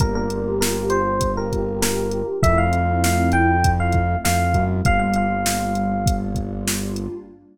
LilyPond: <<
  \new Staff \with { instrumentName = "Electric Piano 1" } { \time 4/4 \key g \minor \tempo 4 = 99 bes'16 bes'8. bes'8 c''8. bes'8. bes'8. r16 | e''16 f''8. f''8 g''8. f''8. f''8. r16 | f''16 f''16 f''2 r4. | }
  \new Staff \with { instrumentName = "Pad 2 (warm)" } { \time 4/4 \key g \minor <bes d' f' g'>2 <bes d' f' g'>2 | <a c' e' f'>2 <a c' e' f'>2 | <g bes d' f'>2 <g bes d' f'>2 | }
  \new Staff \with { instrumentName = "Synth Bass 1" } { \clef bass \time 4/4 \key g \minor g,,1 | f,2. f,8 fis,8 | g,,1 | }
  \new DrumStaff \with { instrumentName = "Drums" } \drummode { \time 4/4 <hh bd>8 hh8 sn8 hh8 <hh bd>8 <hh bd>8 sn8 hh8 | <hh bd>8 hh8 sn8 hh8 <hh bd>8 <hh bd>8 sn8 <hh bd>8 | <hh bd>8 hh8 sn8 hh8 <hh bd>8 <hh bd>8 sn8 hh8 | }
>>